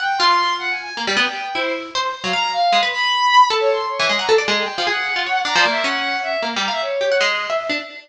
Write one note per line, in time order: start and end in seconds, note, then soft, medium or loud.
0.00 0.17 F#5 medium
0.00 0.18 G5 medium
0.18 0.90 F4 loud
0.18 0.53 C6 medium
0.58 0.70 F#5 medium
0.70 0.82 G#5 medium
0.82 0.94 G#5 medium
0.97 1.06 A#3 medium
1.07 1.16 G3 medium
1.17 1.25 B3 loud
1.17 1.52 G5 medium
1.54 1.90 E4 medium
1.54 1.72 C5 loud
1.95 2.12 C5 loud
2.24 2.33 F#3 medium
2.24 2.32 F5 medium
2.33 2.68 F5 medium
2.33 2.50 A#5 medium
2.52 2.79 F5 loud
2.72 2.81 G#3 medium
2.83 2.91 B4 medium
2.93 3.45 B5 loud
3.50 3.85 A4 loud
3.60 3.69 C#5 loud
3.71 3.88 C6 medium
3.87 4.14 C#5 medium
3.99 4.08 E3 medium
4.09 4.18 G#3 medium
4.18 4.28 F#5 medium
4.18 4.27 A#5 medium
4.29 4.37 A4 loud
4.38 4.47 D5 medium
4.48 4.65 G#3 medium
4.58 4.84 G5 soft
4.78 4.87 F3 medium
4.87 5.13 G#4 medium
4.87 5.41 F#5 medium
5.16 5.25 F4 medium
5.26 5.44 C#5 medium
5.45 5.54 D4 medium
5.45 5.57 A#5 loud
5.56 5.64 F3 loud
5.56 5.69 D5 medium
5.65 5.83 A#3 medium
5.70 5.82 E5 loud
5.84 6.37 C#4 loud
5.84 6.19 F#5 loud
6.22 6.40 E5 loud
6.42 6.54 A#3 medium
6.56 6.68 G3 medium
6.62 6.71 A#5 medium
6.68 6.80 E5 loud
6.68 6.80 F5 medium
6.81 7.16 C#5 medium
7.01 7.10 G4 medium
7.12 7.20 F#5 medium
7.21 7.47 G#3 medium
7.50 7.67 E5 medium
7.69 7.78 D4 medium